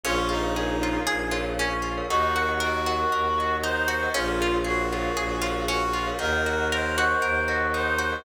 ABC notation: X:1
M:4/4
L:1/16
Q:1/4=117
K:Bbm
V:1 name="Pizzicato Strings"
D2 F2 A2 F2 A2 F2 D2 F2 | E2 G2 B2 G2 B2 G2 E2 G2 | D2 F2 A2 F2 A2 F2 D2 F2 | E2 G2 B2 G2 B2 G2 E2 G2 |]
V:2 name="Clarinet"
F2 E6 z8 | G4 G8 c4 | F4 G8 G4 | B4 c8 c4 |]
V:3 name="Glockenspiel"
[ABdf] [ABdf] [ABdf] [ABdf] [ABdf]2 [ABdf]4 [ABdf]5 [ABdf] | [Beg] [Beg] [Beg] [Beg] [Beg]2 [Beg]4 [Beg]5 [Beg] | [ABdf] [ABdf] [ABdf] [ABdf] [ABdf]2 [ABdf]4 [ABdf]5 [ABdf] | [Beg] [Beg] [Beg] [Beg] [Beg]2 [Beg]4 [Beg]5 [Beg] |]
V:4 name="Violin" clef=bass
B,,,8 B,,,8 | E,,8 E,,8 | B,,,8 B,,,8 | E,,8 E,,8 |]